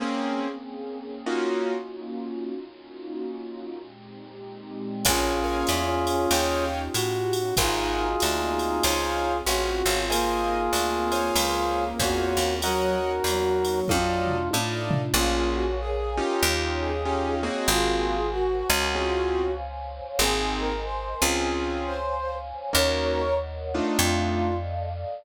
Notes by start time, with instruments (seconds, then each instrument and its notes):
0.00 acoustic grand piano A#3 C4 C#4 G#4, pad 2 (warm) A#3 C4 C#4 G#4
1.26 acoustic grand piano A#3 C#4 D#4 F4 F#4, pad 2 (warm) A#3 C#4 D#4 F4 F#4
2.53 pad 2 (warm) A#3 C#4 D#4 F4 F#4
3.79 pad 2 (warm) A#2 G#3 C4 D#4 G4
5.05 electric bass (finger) A#1, pad 2 (warm) A#3 C#4 F4 G#4, brass section C#4 F4 G#4, acoustic grand piano A#4 C#5 F5 G#5, kick, crash, ride
5.44 acoustic grand piano A#4 C#5 F5 G#5
5.67 electric bass (finger) E2, hi-hat pedal, ride
6.07 ride
6.31 electric bass (finger) D#2, pad 2 (warm) C#4 D#4 F4 G4, acoustic grand piano C#5 D#5 F5 G5, ride
6.94 electric bass (finger) A2, brass section F#4, hi-hat pedal, ride
7.33 ride
7.57 electric bass (finger) G#1, pad 2 (warm) A#3 C4 F#4 G#4, brass section D#4 F4 G#4, acoustic grand piano A#4 C5 F#5 G#5, kick, ride
8.20 electric bass (finger) D2, hi-hat pedal, ride
8.59 ride
8.83 electric bass (finger) C#2, pad 2 (warm) C4 C#4 F4 G#4, acoustic grand piano C5 C#5 F5 G#5, ride
9.45 electric bass (finger) A1, brass section F#4, acoustic grand piano C5 C#5 F5 G#5, hi-hat pedal, ride
9.86 electric bass (finger) G#1, acoustic grand piano C5 C#5 F5 G#5, ride
10.09 brass section A#3 F4 G#4, pad 2 (warm) A#3 C4 D#4 G#4, acoustic grand piano A#4 C5 D#5 G#5, ride
10.73 electric bass (finger) D2, hi-hat pedal, ride
11.12 acoustic grand piano C5 C#5 F5 G#5, ride
11.36 electric bass (finger) C#2, pad 2 (warm) C4 C#4 F4 G#4, ride
11.99 electric bass (finger) E2, brass section F#4, acoustic grand piano C5 C#5 F5 G#5, kick, hi-hat pedal, ride
12.37 electric bass (finger) D#2, ride
12.62 brass section F#3 F#4 A#4, pad 2 (warm) A#3 C#4 D#4 F#4, acoustic grand piano A#4 C#5 D#5 F#5, ride
13.24 electric bass (finger) E2, brass section F#3, hi-hat pedal, ride
13.65 ride
13.88 electric bass (finger) F2, pad 2 (warm) A3 D4 D#4 F4, brass section F4, acoustic grand piano A4 D5 D#5 F5, kick, high tom
14.27 floor tom
14.51 electric bass (finger) A2, acoustic grand piano A4 D5 D#5 F5, high tom
14.91 floor tom
15.14 electric bass (finger) A#1, acoustic grand piano A#3 C#4 F4 G#4, brass section F4, pad 2 (warm) A#4 C#5 F5 G#5
15.53 brass section F#4
15.80 brass section G#4
16.17 acoustic grand piano C#4 D#4 F4 G4
16.42 electric bass (finger) D#2, pad 2 (warm) C#5 D#5 F5 G5
16.80 brass section G#4
17.05 acoustic grand piano C#4 D#4 F4 G4
17.43 acoustic grand piano A#3 C4 F#4 G#4
17.68 electric bass (finger) G#1, brass section F4 G#4, pad 2 (warm) A#4 C5 F#5 G#5
18.31 brass section F#4
18.70 electric bass (finger) C#2
18.95 acoustic grand piano C4 C#4 F4 G#4, pad 2 (warm) C5 C#5 F5 G#5
20.19 electric bass (finger) G#1, acoustic grand piano A#3 C4 D#4 G#4, brass section G#4, pad 2 (warm) A#4 C5 D#5 G#5
20.59 brass section A#4
20.84 brass section C5
21.22 electric bass (finger) C#2, acoustic grand piano C4 C#4 F4 G#4
21.48 pad 2 (warm) C5 C#5 F5 G#5
21.86 brass section C5
22.73 electric bass (finger) D#2, acoustic grand piano A#3 C#4 D#4 F#4, pad 2 (warm) A#4 C#5 D#5 F#5, brass section A#4 C#5
23.74 acoustic grand piano A3 D4 D#4 F4
23.99 electric bass (finger) F2, brass section F4, pad 2 (warm) A4 D5 D#5 F5